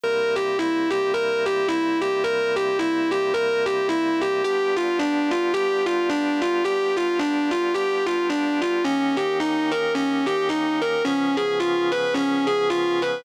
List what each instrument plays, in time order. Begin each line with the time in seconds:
0.04 drawbar organ C3 G3 A#3 E4, distortion guitar A#4
0.35 distortion guitar G4
0.59 distortion guitar E4
0.90 distortion guitar G4
1.14 drawbar organ C3 G3 A#3 E4, distortion guitar A#4
1.46 distortion guitar G4
1.68 distortion guitar E4
2.01 distortion guitar G4
2.24 drawbar organ C3 G3 A#3 E4, distortion guitar A#4
2.56 distortion guitar G4
2.79 distortion guitar E4
3.11 distortion guitar G4
3.34 drawbar organ C3 G3 A#3 E4, distortion guitar A#4
3.66 distortion guitar G4
3.89 distortion guitar E4
4.21 distortion guitar G4
4.44 drawbar organ G3 B3 D4 F4, distortion guitar G4
4.76 distortion guitar F4
4.99 distortion guitar D4
5.31 distortion guitar F4
5.53 drawbar organ G3 B3 D4 F4, distortion guitar G4
5.86 distortion guitar F4
6.09 distortion guitar D4
6.42 distortion guitar F4
6.64 drawbar organ G3 B3 D4 F4, distortion guitar G4
6.96 distortion guitar F4
7.19 distortion guitar D4
7.51 distortion guitar F4
7.74 drawbar organ G3 B3 D4 F4, distortion guitar G4
8.06 distortion guitar F4
8.29 distortion guitar D4
8.61 distortion guitar F4
8.84 drawbar organ D#3 A#3 C#4 G4, distortion guitar C#4
9.17 distortion guitar G4
9.40 distortion guitar D#4
9.71 distortion guitar A#4
9.95 distortion guitar C#4
10.26 distortion guitar G4
10.49 distortion guitar D#4
10.81 distortion guitar A#4
11.04 drawbar organ C#3 F3 B3 G#4, distortion guitar C#4
11.37 distortion guitar G#4
11.60 distortion guitar F4
11.92 distortion guitar B4
12.14 distortion guitar C#4
12.47 distortion guitar G#4
12.70 distortion guitar F4
13.02 distortion guitar B4